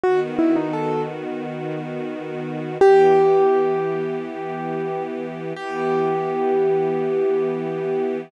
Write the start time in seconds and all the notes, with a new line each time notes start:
0.03 D#3 B3 F#4
0.39 E4
0.56 D#4
0.73 A4
2.80 E3 B3 G4
5.56 E3 B3 G4